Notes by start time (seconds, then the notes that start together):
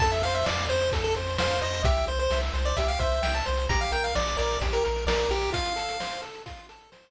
0.00 F2 A4 A5, kick, crash
0.12 E5, closed hi-hat
0.22 F2 C5 F5, closed hi-hat
0.35 E5, closed hi-hat
0.44 F2 D5 F5, snare
0.58 closed hi-hat
0.69 F2 C5, closed hi-hat
0.80 closed hi-hat
0.92 F2 A4, kick, closed hi-hat
1.04 A4, closed hi-hat
1.15 F2 C5, closed hi-hat
1.27 closed hi-hat
1.38 F2 C5 F5, snare
1.50 closed hi-hat
1.61 F2 C5 D#5, closed hi-hat
1.74 closed hi-hat
1.84 C2 G4 E5, kick, closed hi-hat
1.96 closed hi-hat
2.07 C2 C5, closed hi-hat
2.19 C5, closed hi-hat
2.31 C2 E5, snare
2.43 closed hi-hat
2.54 C2 C5, closed hi-hat
2.65 D5, closed hi-hat
2.77 C2 G4 E5, kick, closed hi-hat
2.88 F5, closed hi-hat
2.99 C2 C5 E5, kick, closed hi-hat
3.12 closed hi-hat
3.22 C2 E5 G5, snare
3.35 A5, closed hi-hat
3.46 C2 C5, closed hi-hat
3.57 closed hi-hat
3.69 A#1 G4 A#5, kick, closed hi-hat
3.81 F5, closed hi-hat
3.92 A#1 A#4 G5, closed hi-hat
4.04 F5, closed hi-hat
4.15 A#1 D5, snare
4.27 closed hi-hat
4.37 A#1 A#4 D5, closed hi-hat
4.50 closed hi-hat
4.61 A#1 G4, kick, closed hi-hat
4.73 A#4, closed hi-hat
4.84 A#1 A#4, closed hi-hat
4.96 closed hi-hat
5.06 A#1 A#4 D5, snare
5.19 closed hi-hat
5.29 A#1 G4 A#4, closed hi-hat
5.42 closed hi-hat
5.53 F4 F5, kick, closed hi-hat
5.66 closed hi-hat
5.76 A4, closed hi-hat
5.88 closed hi-hat
6.00 C5, snare
6.12 closed hi-hat
6.22 A4, closed hi-hat
6.34 closed hi-hat
6.46 F4, kick, closed hi-hat
6.57 closed hi-hat
6.69 A4, closed hi-hat
6.81 closed hi-hat
6.92 C5, snare
7.03 closed hi-hat